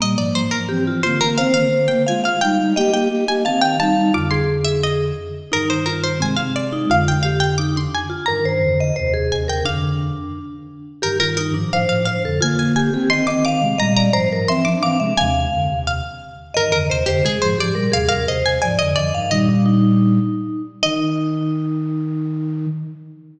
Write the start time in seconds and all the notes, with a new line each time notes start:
0.00 A#2 G3 A#3 D#5
0.17 G#2 F3 D5
0.35 G#2 F3 C5
0.51 G#2 F3 A#4
0.69 E3 C4 G4
0.87 F4
1.03 D3 A#3 F4 C5
1.21 D3 A#3 A#4
1.38 D#3 C4 C5 F5
1.54 D3 A#3 F5
1.73 D3 A#3
1.88 D3 A#3 G5
2.06 G#3 F4 F5 G#5
2.24 F5
2.41 G3 D#4 F5 G5
2.60 G3 D#4
2.76 A#3 G4 D#5 G5
2.92 A#3 G4 G5
3.10 A#3 G4
3.27 A#3 G4 G#5
3.45 D#3 C4 F5 A5
3.61 F5 G5
3.79 G3 D#4 F5 A5
3.96 G3 D#4
4.14 F2 D3 F4 D6
4.31 G#4 C6
4.65 E5
4.83 D#5
5.52 G2 D#3 D#4 A#4
5.70 C5
5.86 F4 A#4
6.04 C5
6.20 C3 G#3 C4 G#5
6.36 C4 F5
6.56 D5
6.72 D#4
6.89 F2 D3 F4 F5
7.08 G5
7.23 G4 F5
7.40 G5
7.58 D#4 D6
7.76 D4 C6
7.95 G#5
8.10 F4
8.26 G2 D#3 A#4 A#5
8.45 G2 D#3 C5
8.62 F2 D3
8.80 D#5
8.96 D#2 C3 C5
9.14 G#4
9.31 D#2 C3 G#5
9.48 D#2 C3 A#4 G5
9.65 F2 D3 D4 F5
11.02 G2 D#3 G4 A#4
11.20 F4 A#4
11.37 D#4 A#4
11.54 G#2 F3 D4
11.72 A2 F3 C5 F5
11.88 A2 F3 F5
12.05 C5 F5
12.24 F2 D3 A4
12.41 D3 A#3 F4 G#5
12.59 G#5
12.76 G4 G#5
12.92 D#3 C4 G4
13.10 D#3 C4 D#5 C6
13.27 D#3 C4 D#5 D6
13.45 F5 D6
13.61 C3 G#3
13.78 A#2 G3 D#5 A#5
13.96 D5 A#5
14.13 G#2 F3 C5 A#5
14.32 G#2 F3 A#4
14.48 E3 C4 E5 C6
14.64 F3 D4 D6
14.83 E3 C4 F5 D6
14.99 C3 G#3 E5
15.17 D#2 C3 F5 G#5
15.52 F2 D3
15.68 D#2 C3
15.87 F5
16.54 G2 D#3 A#4 D#5
16.72 F2 D3 A#4
16.89 D#2 C3 C5
17.06 F2 D3 G4 C5
17.23 C3 G#3 G#4
17.42 G#2 F3 C5
17.58 G#2 F3 G4 D5
17.75 A#2 G3 A#4
17.92 D#2 C3 G#4 F5
18.09 D#2 C3 A#4 F5
18.28 D#2 C3 C5 D#5
18.44 D#2 C3 G#5
18.62 G#2 F3 D5 G#5
18.79 F2 D3 D#5
18.96 F2 D3 D5 D#5
19.14 G2 D#3 F5
19.31 A#2 G3 D#4 D#5
19.49 D4
19.66 D#4
20.83 D#3 D#4 D#5